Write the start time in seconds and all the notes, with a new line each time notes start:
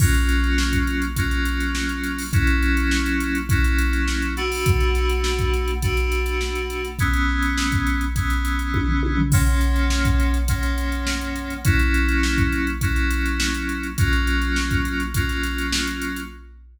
0.00 F#3 A#3 C#4 F4, kick, crash
0.14 closed hi-hat
0.29 snare, closed hi-hat
0.44 closed hi-hat
0.58 snare
0.73 kick, closed hi-hat
0.87 closed hi-hat
1.02 closed hi-hat
1.16 F#3 A#3 C#4 F4, kick, closed hi-hat
1.31 closed hi-hat
1.45 closed hi-hat
1.60 closed hi-hat
1.75 snare
1.89 closed hi-hat
2.04 snare, closed hi-hat
2.18 open hi-hat
2.33 F#3 A#3 C#4 E4, kick, closed hi-hat
2.47 closed hi-hat
2.62 closed hi-hat
2.77 closed hi-hat
2.91 snare
3.06 closed hi-hat
3.20 snare, closed hi-hat
3.35 closed hi-hat
3.49 F#3 A#3 C#4 E4, kick, closed hi-hat
3.64 closed hi-hat
3.79 closed hi-hat
3.93 closed hi-hat
4.08 snare
4.22 closed hi-hat
4.37 B2 A3 D4 F#4, closed hi-hat
4.52 open hi-hat
4.66 kick, closed hi-hat
4.80 closed hi-hat
4.95 snare, closed hi-hat
5.09 closed hi-hat
5.24 snare
5.39 kick, closed hi-hat
5.54 closed hi-hat
5.68 closed hi-hat
5.82 B2 A3 D4 F#4, kick, closed hi-hat
5.97 closed hi-hat
6.12 closed hi-hat
6.26 closed hi-hat
6.41 snare
6.55 closed hi-hat
6.70 closed hi-hat
6.85 closed hi-hat
6.99 E3 G#3 B3 C#4, kick, closed hi-hat
7.13 closed hi-hat
7.29 snare
7.42 closed hi-hat
7.58 snare
7.72 kick, closed hi-hat
7.87 closed hi-hat
8.01 closed hi-hat
8.16 E3 G#3 B3 C#4, kick, closed hi-hat
8.30 closed hi-hat
8.45 closed hi-hat
8.59 closed hi-hat
8.74 kick, high tom
8.88 floor tom
9.03 high tom
9.17 floor tom
9.32 F#2 F3 A#3 C#4, kick, crash
9.47 closed hi-hat
9.61 closed hi-hat
9.76 closed hi-hat
9.90 snare
10.05 kick, closed hi-hat
10.20 closed hi-hat
10.34 closed hi-hat
10.48 F#2 F3 A#3 C#4, kick, closed hi-hat
10.63 closed hi-hat
10.78 closed hi-hat
10.92 closed hi-hat
11.07 snare
11.21 closed hi-hat
11.36 closed hi-hat
11.50 closed hi-hat
11.65 F#3 A#3 C#4 E4, kick, closed hi-hat
11.79 closed hi-hat
11.94 closed hi-hat
12.08 closed hi-hat
12.23 snare
12.38 kick, closed hi-hat
12.52 closed hi-hat
12.67 closed hi-hat
12.81 F#3 A#3 C#4 E4, kick, closed hi-hat
12.96 closed hi-hat
13.11 closed hi-hat
13.26 closed hi-hat
13.40 snare
13.54 closed hi-hat
13.69 closed hi-hat
13.83 closed hi-hat
13.98 F#3 A#3 C#4 F4, kick, closed hi-hat
14.13 closed hi-hat
14.27 closed hi-hat
14.42 closed hi-hat
14.56 snare
14.71 kick, closed hi-hat
14.85 closed hi-hat
15.00 closed hi-hat
15.14 F#3 A#3 C#4 F4, kick, closed hi-hat
15.29 snare, closed hi-hat
15.43 snare, closed hi-hat
15.58 closed hi-hat
15.72 snare
15.87 closed hi-hat
16.02 closed hi-hat
16.16 closed hi-hat